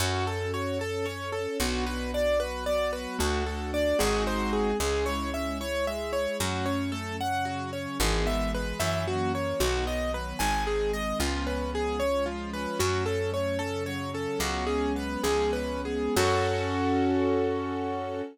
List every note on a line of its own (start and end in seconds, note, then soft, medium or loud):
0.00 1.47 F#2 medium
0.00 0.23 C#4 medium
0.00 0.78 C#4 medium
0.00 0.78 F#4 medium
0.00 0.26 F#4 medium
0.00 0.78 A4 medium
0.26 0.50 A4 medium
0.26 0.52 A4 medium
0.54 0.78 F#4 medium
0.54 0.78 C#5 medium
0.79 1.59 C#4 medium
0.79 1.03 A4 medium
0.79 1.59 A4 medium
0.79 1.05 A4 medium
0.79 1.59 C#5 medium
1.05 1.30 C#4 medium
1.05 1.30 C#5 medium
1.32 1.57 A4 medium
1.32 1.58 A4 medium
1.59 3.07 B1 medium
1.59 2.39 B3 medium
1.59 1.85 B3 medium
1.59 2.39 D4 medium
1.59 2.39 F#4 medium
1.59 1.84 F#4 medium
1.86 2.11 F#4 medium
1.86 2.11 B4 medium
2.14 2.38 D4 medium
2.14 2.39 D5 medium
2.40 3.19 F#3 medium
2.40 3.19 B3 medium
2.40 2.64 F#4 medium
2.40 3.18 F#4 medium
2.40 2.64 B4 medium
2.66 2.91 B3 medium
2.66 2.91 D5 medium
2.93 3.17 F#4 medium
2.93 3.17 B4 medium
3.19 3.94 D2 medium
3.19 3.43 A3 medium
3.19 3.98 A3 medium
3.19 3.98 D4 medium
3.19 3.98 F#4 medium
3.19 3.44 F#4 medium
3.46 3.71 F#4 medium
3.46 3.71 A4 medium
3.73 3.97 D4 medium
3.73 3.98 D5 medium
3.99 4.74 G#1 medium
3.99 4.71 G#3 medium
3.99 4.79 G#3 medium
3.99 4.71 C4 medium
3.99 4.79 C4 medium
3.99 4.71 D#4 medium
3.99 4.79 D#4 medium
3.99 4.71 F#4 medium
3.99 4.79 F#4 medium
3.99 4.23 G#4 medium
4.27 4.51 C5 medium
4.53 4.77 G#4 medium
4.80 6.27 C#2 medium
4.80 5.04 G#3 medium
4.80 5.60 G#3 medium
4.80 5.60 C#4 medium
4.80 5.60 E4 medium
4.80 5.05 G#4 medium
5.06 5.30 E4 medium
5.06 5.30 C#5 medium
5.34 5.58 C#4 medium
5.34 5.58 E5 medium
5.60 6.40 G#3 medium
5.60 5.84 E4 medium
5.60 6.40 E4 medium
5.60 6.40 G#4 medium
5.60 5.85 C#5 loud
5.87 6.12 G#3 medium
5.87 6.12 E5 medium
6.12 6.36 E4 medium
6.12 6.37 C#5 medium
6.40 7.87 F#2 medium
6.40 6.64 F#3 medium
6.40 7.20 F#3 medium
6.40 7.20 A3 medium
6.40 7.20 C#4 medium
6.40 6.65 F#4 medium
6.66 6.90 C#4 medium
6.66 6.90 C#5 medium
6.92 7.17 A3 medium
6.92 7.16 A4 medium
7.20 8.00 C#3 medium
7.20 8.00 F#3 medium
7.20 7.44 C#4 medium
7.20 8.00 C#4 medium
7.20 7.45 F#5 medium
7.45 7.71 F#3 medium
7.45 7.70 F#4 medium
7.73 7.98 C#4 medium
7.73 7.97 C#5 medium
7.99 8.73 G#1 medium
7.99 8.78 E3 medium
7.99 8.25 E3 medium
7.99 8.78 G#3 medium
7.99 8.78 B3 medium
7.99 8.26 G#4 medium
8.25 8.49 B3 medium
8.25 8.51 E5 medium
8.54 8.78 G#3 medium
8.54 8.79 B4 medium
8.80 9.54 F#2 medium
8.80 9.05 E3 loud
8.80 9.61 E3 medium
8.80 9.60 F#3 medium
8.80 9.61 A#3 medium
8.80 9.61 C#4 medium
8.80 9.04 E5 medium
9.06 9.30 F#3 medium
9.06 9.32 F#4 medium
9.33 9.57 A#3 medium
9.33 9.59 C#5 medium
9.60 10.34 B1 medium
9.60 9.84 D#3 medium
9.60 10.40 D#3 medium
9.60 10.40 F#3 medium
9.60 10.40 B3 medium
9.60 9.85 F#4 medium
9.85 10.09 B3 medium
9.85 10.12 D#5 medium
10.13 10.37 F#3 medium
10.13 10.39 B4 medium
10.39 11.13 G#1 medium
10.39 11.19 D#3 medium
10.39 10.65 D#3 medium
10.39 11.19 G#3 medium
10.39 11.19 C4 medium
10.39 10.64 G#5 medium
10.67 10.92 C4 medium
10.67 10.91 G#4 medium
10.93 11.18 G#3 medium
10.93 11.18 D#5 medium
11.19 12.67 C#2 medium
11.19 11.43 F3 medium
11.19 12.00 F3 medium
11.19 12.00 G#3 medium
11.19 12.00 B3 medium
11.19 12.00 C#4 medium
11.19 11.45 F4 medium
11.47 11.71 C#4 medium
11.47 11.71 B4 medium
11.73 11.97 B3 medium
11.73 11.99 G#4 medium
11.99 12.79 F3 medium
11.99 12.79 G#3 medium
11.99 12.23 C#4 medium
11.99 12.79 C#4 medium
11.99 12.79 F4 medium
11.99 12.24 C#5 medium
12.26 12.51 F3 medium
12.26 12.50 F4 medium
12.53 12.79 C#4 medium
12.53 12.78 B4 medium
12.79 14.27 F#2 medium
12.79 13.03 F#3 medium
12.79 13.58 F#3 medium
12.79 13.59 A3 medium
12.79 13.58 C#4 medium
12.79 13.04 F#4 medium
13.06 13.32 C#4 medium
13.06 13.30 A4 medium
13.32 13.56 A3 medium
13.32 13.58 C#5 medium
13.58 14.38 C#3 medium
13.58 14.38 F#3 medium
13.58 14.38 C#4 medium
13.58 13.83 C#4 medium
13.58 13.83 A4 medium
13.86 14.11 F#3 medium
13.86 14.11 C#5 medium
14.14 14.38 C#4 medium
14.14 14.39 A4 medium
14.39 15.17 C#2 medium
14.39 15.22 F#3 medium
14.39 14.64 F#3 medium
14.39 15.22 G#3 medium
14.39 15.22 B3 medium
14.39 15.22 C#4 medium
14.39 14.66 F#4 medium
14.67 14.93 C#4 medium
14.67 14.92 G#4 medium
14.96 15.22 B3 medium
14.96 15.23 B4 medium
15.23 16.09 C#2 medium
15.23 16.15 F3 medium
15.23 15.52 F3 medium
15.23 16.15 G#3 medium
15.23 16.15 B3 medium
15.23 16.15 C#4 medium
15.23 15.51 G#4 medium
15.53 15.82 C#4 medium
15.53 15.81 B4 medium
15.85 16.14 B3 medium
15.85 16.14 G#4 medium
16.16 18.22 F#2 loud
16.16 18.21 C#4 medium
16.16 18.22 C#4 loud
16.16 18.21 F#4 loud
16.16 18.22 F#4 loud
16.16 18.21 A4 loud
16.16 18.22 A4 loud